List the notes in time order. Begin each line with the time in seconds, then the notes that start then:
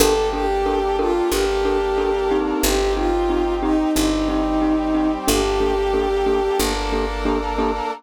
0.00 G1 A#3 D4 G4 A4 A#4
0.33 D4 G4 A4 A#4
0.66 D4 G4 A4 A#4
0.99 D4 F4 G4 A4 A#4
1.30 G1 A#3 D4 G4 A4 A#4
1.65 D4 G4 A4 A#4
1.98 D4 G4 A4 A#4
2.31 C4 D#4 G4
2.62 G1 C4 D#4 G4
2.96 C4 D#4 F4 G4
3.30 C4 D#4 G4
3.62 C4 D#4 G4
3.95 G1 G3 C4 D#4 G4
4.29 C4 D#4 G4
4.62 C4 D#4 G4
4.95 C4 D#4 G4
5.27 G1 A#3 D4 G4 A4
5.60 A#3 D4 G4 A4
5.93 A#3 D4 G4 A4
6.26 A#3 D4 G4 A4
6.59 G1 A#3 D4 G4 A4 A#4
6.92 A#3 D4 G4 A4
7.25 A#3 D4 G4 A4
7.58 A#3 D4 G4 A4